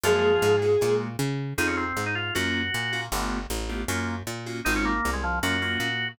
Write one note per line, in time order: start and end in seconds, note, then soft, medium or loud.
0.03 0.38 F#2 medium
0.03 0.56 F3 medium
0.03 0.31 G#3 medium
0.03 0.31 A#3 medium
0.03 0.31 F4 medium
0.03 0.56 F4 medium
0.03 0.31 F#4 medium
0.03 0.93 G#4 medium
0.42 0.77 G#2 medium
0.62 0.75 G#3 medium
0.62 0.75 A#3 medium
0.62 0.75 F4 medium
0.62 0.75 F#4 medium
0.81 1.17 A#2 medium
0.81 1.08 G#3 medium
0.81 1.08 A#3 medium
0.81 1.08 F4 medium
0.81 1.08 F#4 medium
1.19 1.54 C#3 medium
1.58 1.93 F2 medium
1.58 1.85 C4 medium
1.58 1.85 D#4 medium
1.58 1.67 D#4 loud
1.58 1.85 F4 medium
1.58 1.85 G#4 medium
1.67 1.76 C#4 medium
1.77 2.05 C4 medium
1.97 2.31 G#2 medium
2.06 2.15 D#4 medium
2.15 2.34 F4 medium
2.35 2.70 F#2 medium
2.35 2.62 A#3 medium
2.35 2.62 C#4 medium
2.35 2.62 F4 medium
2.35 2.62 F#4 medium
2.35 3.01 F#4 medium
2.74 3.09 A#2 medium
2.93 3.06 A#3 medium
2.93 3.06 C#4 medium
2.93 3.06 F4 medium
2.93 3.06 F#4 medium
3.12 3.47 G1 medium
3.12 3.39 A3 medium
3.12 3.39 B3 medium
3.12 3.39 F4 medium
3.12 3.39 G4 medium
3.50 3.85 A1 medium
3.69 3.83 A3 medium
3.69 3.83 B3 medium
3.69 3.83 F4 medium
3.69 3.83 G4 medium
3.88 4.23 F#2 medium
3.88 4.15 A#3 medium
3.88 4.15 C#4 medium
3.88 4.15 F4 medium
3.88 4.15 F#4 medium
4.27 4.62 A#2 medium
4.46 4.60 A#3 medium
4.46 4.60 C#4 medium
4.46 4.60 F4 medium
4.46 4.60 F#4 medium
4.65 5.01 G#1 medium
4.65 4.92 G#3 medium
4.65 4.92 C4 medium
4.65 4.74 D#4 loud
4.65 4.92 D#4 medium
4.65 4.92 F4 medium
4.76 4.85 C#4 medium
4.85 5.11 A#3 medium
5.05 5.40 C2 medium
5.13 5.22 G#3 medium
5.24 5.39 F3 medium
5.43 5.78 F#2 medium
5.43 5.56 A#3 medium
5.43 5.56 C#4 medium
5.43 5.56 F4 medium
5.43 5.56 F#4 medium
5.43 6.08 F#4 medium
5.62 5.89 A#3 medium
5.62 5.89 C#4 medium
5.62 5.89 F4 medium
5.62 5.89 F#4 medium
5.80 6.15 A#2 medium